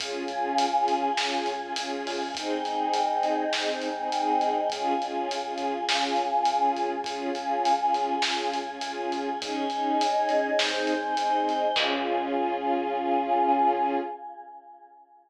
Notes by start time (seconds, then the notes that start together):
0.00 C#2 C#4 F4 G#4, kick, closed hi-hat
0.28 C#2 C#4 F4 G#4, closed hi-hat
0.58 C#2, closed hi-hat
0.74 C#4 F4 G#4
0.88 C#2, kick, closed hi-hat
1.17 C#2 C#4 F4 G#4, snare
1.46 C#2, closed hi-hat
1.62 C#4 F4 G#4
1.75 C#2 C#4 F4 G#4, closed hi-hat
2.06 C#2, open hi-hat
2.35 C#2 C4 D#4 G#4, kick, closed hi-hat
2.64 C#2 C4 D#4 G#4, closed hi-hat
2.94 C#2, closed hi-hat
3.09 C4 D#4 G#4
3.23 C#2, closed hi-hat
3.53 C#2 C4 D#4 G#4, snare
3.81 C#2, closed hi-hat
3.97 C4 D#4 G#4
4.12 C#2 C4 D#4 G#4, closed hi-hat
4.41 C#2, closed hi-hat
4.70 C#2 C#4 F4 G#4, kick, closed hi-hat
5.00 C#2 C#4 F4 G#4, closed hi-hat
5.29 C2, closed hi-hat
5.45 C#4 F4 G#4
5.58 C#2, closed hi-hat
5.88 C#2 C#4 F4 G#4, snare
6.16 C#2, closed hi-hat
6.31 C#4 F4 G#4
6.45 C#2 C#4 F4 G#4, closed hi-hat
6.76 C#2, closed hi-hat
7.04 C#2 C#4 F4 G#4, kick, closed hi-hat
7.35 C#2 C#4 F4 G#4, closed hi-hat
7.65 C#2, closed hi-hat
7.80 C#4 F4 G#4
7.94 C#2, closed hi-hat
8.22 C#2 C#4 F4 G#4, snare
8.53 C#2, closed hi-hat
8.67 C#4 F4 G#4
8.81 C#2 C#4 F4 G#4, closed hi-hat
9.12 C#2, closed hi-hat
9.41 C#2 C#4 D#4 G#4 C#5 D#5 G#5, kick, closed hi-hat
9.70 C#2 C#4 D#4 G#4, closed hi-hat
10.00 C#2, closed hi-hat
10.15 C#4 D#4 G#4
10.29 C#2, kick, closed hi-hat
10.58 C#2 C4 D#4 G#4 C5 D#5 G#5, snare
10.87 C#2, closed hi-hat
11.03 C4 D#4 G#4
11.17 C#2 C4 D#4 G#4, closed hi-hat
11.47 C#2, closed hi-hat
11.76 C#2 C#4 F4 G#4, kick, crash